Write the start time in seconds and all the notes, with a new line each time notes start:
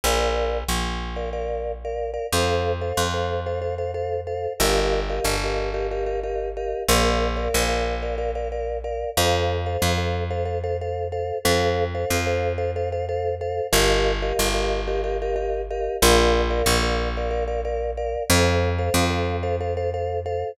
0.04 A#1 A#4 D5 F5
0.68 A#1
1.16 A#4 D5 F5
1.33 A#4 D5 F5
1.85 A#4 D5 F5
2.14 A#4 D5 F5
2.32 F2 A4 C5 F5
2.81 A4 C5 F5
2.97 F2
3.14 A4 C5 F5
3.46 A4 C5 F5
3.62 A4 C5 F5
3.78 A4 C5 F5
3.94 A4 C5 F5
4.27 A4 C5 F5
4.60 G1 G4 A#4 D#5 F5
5.09 G4 A#4 D#5 F5
5.24 G1
5.43 G4 A#4 D#5 F5
5.74 G4 A#4 D#5 F5
5.91 G4 A#4 D#5 F5
6.06 G4 A#4 D#5 F5
6.23 G4 A#4 D#5 F5
6.57 G4 A#4 D#5 F5
6.88 A#1 A#4 D5 F5
7.37 A#4 D5 F5
7.54 A#1
7.68 A#4 D5 F5
8.02 A#4 D5 F5
8.18 A#4 D5 F5
8.35 A#4 D5 F5
8.52 A#4 D5 F5
8.84 A#4 D5 F5
9.17 F2 A4 C5 F5
9.66 A4 C5 F5
9.82 F2
9.97 A4 C5 F5
10.30 A4 C5 F5
10.45 A4 C5 F5
10.63 A4 C5 F5
10.81 A4 C5 F5
11.12 A4 C5 F5
11.45 F2 A4 C5 F5
11.95 A4 C5 F5
12.10 F2
12.26 A4 C5 F5
12.58 A4 C5 F5
12.76 A4 C5 F5
12.92 A4 C5 F5
13.09 A4 C5 F5
13.41 A4 C5 F5
13.72 G1 G4 A#4 D#5 F5
14.22 G4 A#4 D#5 F5
14.39 G1
14.54 G4 A#4 D#5 F5
14.88 G4 A#4 D#5 F5
15.04 G4 A#4 D#5 F5
15.22 G4 A#4 D#5 F5
15.36 G4 A#4 D#5 F5
15.70 G4 A#4 D#5 F5
16.02 A#1 A#4 D5 F5
16.50 A#4 D5 F5
16.66 A#1
16.82 A#4 D5 F5
17.17 A#4 D5 F5
17.31 A#4 D5 F5
17.48 A#4 D5 F5
17.65 A#4 D5 F5
17.97 A#4 D5 F5
18.30 F2 A4 C5 F5
18.78 A4 C5 F5
18.94 F2
19.10 A4 C5 F5
19.43 A4 C5 F5
19.60 A4 C5 F5
19.77 A4 C5 F5
19.94 A4 C5 F5
20.26 A4 C5 F5